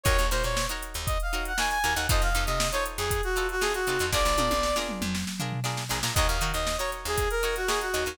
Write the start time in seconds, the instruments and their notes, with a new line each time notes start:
0.03 electric bass (finger) D#2, pizzicato strings D#4 F#4 A#4 C#5, brass section C#5, kick, closed hi-hat
0.19 electric bass (finger) D#2, closed hi-hat
0.31 electric bass (finger) A#2, pizzicato strings D#4 F#4 A#4 C#5, brass section C5, closed hi-hat
0.43 electric bass (finger) A#2, brass section C#5, snare, closed hi-hat
0.57 snare
0.69 pizzicato strings D#4 F#4 A#4 C#5, closed hi-hat
0.83 closed hi-hat
0.94 electric bass (finger) D#2, closed hi-hat
1.06 brass section D#5, kick, closed hi-hat
1.20 brass section F5, closed hi-hat
1.33 pizzicato strings D#4 F#4 A#4 C#5, closed hi-hat
1.45 brass section F#5, closed hi-hat
1.58 pizzicato strings D#4 F#4 A#4 C#5, brass section G#5, snare
1.69 brass section G#5, closed hi-hat
1.84 electric bass (finger) D#2, pizzicato strings D#4 F#4 A#4 C#5, snare, closed hi-hat
1.95 electric bass (finger) D#2, pizzicato strings D#4 F#4 A#4 C#5, brass section F#5, closed hi-hat
2.09 electric bass (finger) F2, pizzicato strings D#4 F4 A4 C5, brass section D#5, kick, closed hi-hat
2.22 electric bass (finger) F2, brass section F5, closed hi-hat
2.35 electric bass (finger) F2, pizzicato strings D#4 F4 A4 C5, closed hi-hat
2.46 electric bass (finger) C3, brass section D#5, closed hi-hat
2.60 snare
2.72 pizzicato strings D#4 F4 A4 C5, brass section C#5, closed hi-hat
2.86 closed hi-hat
2.97 electric bass (finger) F2, brass section G#4, closed hi-hat
3.11 kick, closed hi-hat
3.23 brass section F#4, closed hi-hat
3.36 pizzicato strings D#4 F4 A4 C5, closed hi-hat
3.49 brass section F#4, closed hi-hat
3.61 pizzicato strings D#4 F4 A4 C5, brass section G#4, snare
3.74 brass section F#4, closed hi-hat
3.87 electric bass (finger) C3, pizzicato strings D#4 F4 A4 C5, closed hi-hat
3.99 electric bass (finger) F2, pizzicato strings D#4 F4 A4 C5, snare, closed hi-hat
4.13 electric bass (finger) A#1, pizzicato strings D4 F4 G#4 A#4, brass section D5, kick, snare
4.25 electric bass (finger) A#1, snare
4.38 electric bass (finger) A#2, pizzicato strings D4 F4 G#4 A#4, high tom
4.50 electric bass (finger) A#1, high tom
4.63 snare
4.76 pizzicato strings D4 F4 G#4 A#4, snare
4.89 mid tom
5.01 electric bass (finger) F2, mid tom
5.15 snare
5.27 snare
5.40 pizzicato strings D4 F4 G#4 A#4, floor tom
5.52 floor tom
5.64 pizzicato strings D4 F4 G#4 A#4, snare
5.77 snare
5.89 electric bass (finger) A#1, pizzicato strings D4 F4 G#4 A#4, snare
6.03 electric bass (finger) A#2, pizzicato strings D4 F4 G#4 A#4, snare
6.15 electric bass (finger) D#2, pizzicato strings D#4 F#4 A#4, brass section D#5, kick, closed hi-hat
6.19 pizzicato strings C#5
6.27 electric bass (finger) D#2, brass section F5, closed hi-hat
6.41 electric bass (finger) D#3, pizzicato strings D#4 F#4 A#4 C#5, closed hi-hat
6.53 electric bass (finger) D#2, brass section D#5, closed hi-hat
6.67 snare
6.78 pizzicato strings D#4 F#4 A#4 C#5, brass section C#5, closed hi-hat
6.92 snare, closed hi-hat
7.05 electric bass (finger) D#2, brass section G#4, closed hi-hat
7.18 kick, closed hi-hat
7.31 brass section A#4, closed hi-hat
7.43 pizzicato strings D#4 F#4 A#4 C#5, snare, closed hi-hat
7.56 brass section F#4, snare, closed hi-hat
7.67 pizzicato strings D#4 F#4 A#4 C#5, brass section G#4, snare
7.81 brass section F#4, closed hi-hat
7.94 electric bass (finger) D#2, pizzicato strings D#4 F#4 A#4 C#5, closed hi-hat
8.06 electric bass (finger) D#2, pizzicato strings D#4 F#4 A#4 C#5, closed hi-hat